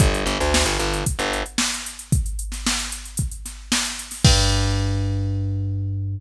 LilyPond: <<
  \new Staff \with { instrumentName = "Electric Bass (finger)" } { \clef bass \time 4/4 \key g \minor \tempo 4 = 113 g,,8 g,,16 d,8 g,,16 g,,8. g,,4.~ g,,16~ | g,,1 | g,1 | }
  \new DrumStaff \with { instrumentName = "Drums" } \drummode { \time 4/4 <hh bd>16 hh16 hh16 <hh sn>16 sn16 <hh sn>16 hh16 hh16 <hh bd>16 <hh sn>16 hh16 hh16 sn16 hh16 hh16 hh16 | <hh bd>16 hh16 hh16 <hh sn>16 sn16 hh16 hh16 hh16 <hh bd>16 hh16 <hh sn>8 sn16 hh16 hh16 <hho sn>16 | <cymc bd>4 r4 r4 r4 | }
>>